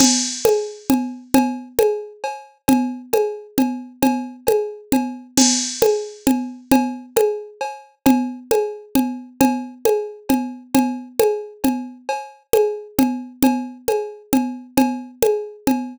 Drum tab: CC |x--------|---------|---------|---------|
CB |x--x--x--|x--x--x--|x--x--x--|x--x--x--|
CG |O--o--O--|O--o-----|O--o--O--|O--o--O--|

CC |x--------|---------|---------|---------|
CB |x--x--x--|x--x--x--|x--x--x--|x--x--x--|
CG |O--o--O--|O--o-----|O--o--O--|O--o--O--|

CC |---------|---------|---------|---------|
CB |x--x--x--|x--x--x--|x--x--x--|x--x--x--|
CG |O--o--O--|---o--O--|O--o--O--|O--o--O--|